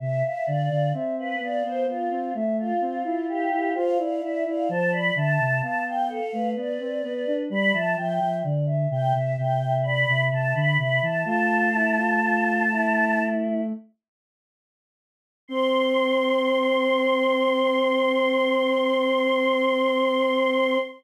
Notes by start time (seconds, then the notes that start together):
0.00 C3 E5
0.23 E5 F5
0.46 D3 D5 F5
0.69 D3 F5
0.93 C4 E5
1.18 B4 F5
1.39 B3 D5 F5
1.63 B3 C5
1.87 B3 F4 F5
2.10 C4 F5
2.34 A3 E5
2.58 F4 F5
2.80 C4 F4
3.04 E4 F4
3.29 G4 F5
3.52 E4
3.74 F4 C5 F5
3.98 E4 D5 F5
4.21 E4 D5 E5
4.46 E4 D5 F5
4.69 F3 C5 A5
4.91 D5 B5
5.15 D3 E5 A5
5.39 C3
5.61 B3 F5 A5
5.86 F5 G5
6.09 A4 F5
6.33 A3 B4
6.56 B3 D5
6.80 C4
7.02 B3 B4
7.27 D4
7.50 G3 D5 B5
7.73 F3 E5 A5
7.96 F3 E5 G5
8.20 F3 E5
8.44 D3 D5
8.66 E5
8.89 C3 E5 G5
9.14 C3 E5
9.37 C3 E5 G5
9.62 E5
9.83 D5 B5
10.08 C3 E5
10.31 C3 A5
10.54 D3 B5
10.78 C3 E5 B5
11.02 E3 A5
11.24 A3 F4 A5
11.73 E4
11.96 F4
12.21 F4
12.72 E4
15.48 C4 C6